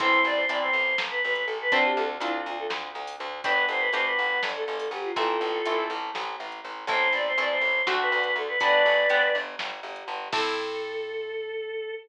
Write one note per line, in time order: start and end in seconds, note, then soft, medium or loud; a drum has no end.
0.00 0.20 A1 loud
0.00 0.44 C4 medium
0.00 0.44 E4 medium
0.00 0.44 A4 medium
0.00 0.22 C5 loud
0.00 kick medium
0.00 closed hi-hat medium
0.24 0.45 A1 medium
0.24 0.36 D5 loud
0.35 0.47 C5 loud
0.48 0.70 A1 medium
0.48 1.60 C4 medium
0.48 1.60 E4 medium
0.48 1.60 A4 medium
0.48 0.60 D5 medium
0.48 closed hi-hat medium
0.62 0.96 C5 loud
0.73 0.94 A1 medium
0.98 1.20 A1 medium
0.98 snare loud
1.10 1.22 B4 loud
1.24 1.45 A1 medium
1.24 1.33 B4 loud
1.34 1.45 B4 medium
1.34 closed hi-hat medium
1.46 1.69 A1 medium
1.46 1.58 A4 loud
1.62 1.73 B4 loud
1.71 1.93 D2 medium
1.71 2.16 C4 loud
1.71 2.16 D4 medium
1.71 2.16 F4 medium
1.71 2.16 A4 medium
1.71 1.83 C5 loud
1.71 kick medium
1.71 closed hi-hat medium
1.85 1.97 G4 loud
1.97 2.18 D2 loud
1.97 2.09 A4 loud
2.20 2.41 D2 medium
2.20 3.32 C4 medium
2.20 3.32 D4 medium
2.20 2.31 E4 loud
2.20 3.32 F4 medium
2.20 3.32 A4 medium
2.20 closed hi-hat medium
2.46 2.67 D2 medium
2.46 2.58 F4 loud
2.59 2.71 A4 medium
2.70 2.91 D2 medium
2.70 snare medium
2.95 3.16 D2 medium
3.07 open hi-hat medium
3.20 3.41 D2 loud
3.44 3.66 G1 medium
3.44 3.89 B3 medium
3.44 3.89 D4 medium
3.44 3.89 F#4 medium
3.44 3.89 G4 medium
3.44 3.65 B4 loud
3.44 kick medium
3.44 closed hi-hat medium
3.69 3.89 G1 medium
3.69 3.82 C5 loud
3.79 3.91 B4 loud
3.93 4.14 G1 medium
3.93 5.04 B3 medium
3.93 5.04 D4 medium
3.93 5.04 F#4 medium
3.93 5.04 G4 medium
3.93 4.04 C5 loud
3.93 closed hi-hat medium
4.05 4.41 B4 loud
4.19 4.40 G1 medium
4.43 4.64 G1 medium
4.43 snare medium
4.56 4.65 A4 loud
4.66 4.89 G1 medium
4.66 4.77 A4 medium
4.78 4.90 A4 loud
4.78 open hi-hat medium
4.91 5.12 G1 medium
4.91 5.05 G4 loud
5.04 5.15 F4 loud
5.16 5.37 A1 loud
5.16 5.61 A3 medium
5.16 5.61 C4 medium
5.16 5.61 E4 medium
5.16 5.84 F4 loud
5.16 5.84 A4 loud
5.16 kick medium
5.16 closed hi-hat medium
5.41 5.62 A1 medium
5.65 5.88 A1 medium
5.65 6.76 A3 medium
5.65 6.76 C4 medium
5.65 6.76 E4 medium
5.65 closed hi-hat medium
5.90 6.11 A1 loud
6.15 6.36 A1 loud
6.15 snare medium
6.40 6.61 A1 medium
6.52 closed hi-hat medium
6.64 6.85 A1 medium
6.87 7.08 A1 loud
6.87 7.33 A3 medium
6.87 7.33 C4 medium
6.87 7.33 E4 medium
6.87 7.13 C5 loud
6.87 kick medium
6.87 closed hi-hat medium
7.12 7.33 A1 medium
7.12 7.25 D5 loud
7.27 7.39 C5 loud
7.38 7.59 A1 medium
7.38 7.82 A3 medium
7.38 7.82 C4 medium
7.38 7.82 E4 medium
7.38 7.51 D5 loud
7.38 closed hi-hat medium
7.51 7.81 C5 loud
7.61 7.82 A1 medium
7.87 8.09 D2 loud
7.87 8.53 A3 loud
7.87 8.53 C4 medium
7.87 8.53 D4 medium
7.87 8.53 F#4 medium
7.87 snare medium
8.01 8.10 B4 loud
8.10 8.33 D2 medium
8.10 8.22 B4 loud
8.22 8.34 B4 loud
8.22 closed hi-hat medium
8.36 8.57 D2 medium
8.36 8.49 A4 loud
8.48 8.60 B4 loud
8.60 8.82 G1 medium
8.60 9.05 B3 medium
8.60 9.05 D4 medium
8.60 9.05 F#4 medium
8.60 9.05 G4 medium
8.60 9.33 B4 loud
8.60 9.33 D5 loud
8.60 kick medium
8.60 closed hi-hat medium
8.86 9.07 G1 medium
9.10 9.31 G1 medium
9.10 10.20 B3 medium
9.10 10.20 D4 medium
9.10 10.20 F#4 medium
9.10 10.20 G4 medium
9.10 closed hi-hat medium
9.35 9.56 G1 medium
9.59 9.81 G1 medium
9.59 snare medium
9.83 10.04 G1 medium
9.96 closed hi-hat medium
10.08 10.29 G1 medium
10.32 11.92 A2 loud
10.32 11.92 C4 medium
10.32 11.92 E4 medium
10.32 11.92 A4 loud
10.32 11.94 A4 loud
10.32 kick loud
10.32 crash loud